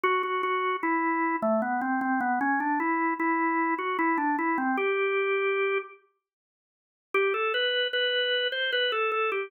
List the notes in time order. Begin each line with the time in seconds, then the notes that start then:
0.04 F#4
0.23 F#4
0.43 F#4
0.83 E4
1.42 A3
1.62 B3
1.81 C4
2.01 C4
2.21 B3
2.41 C#4
2.60 D4
2.80 E4
3.20 E4
3.79 F#4
3.99 E4
4.18 D4
4.39 E4
4.58 C4
4.77 G4
7.14 G4
7.34 A4
7.54 B4
7.93 B4
8.52 C5
8.73 B4
8.92 A4
9.12 A4
9.32 G4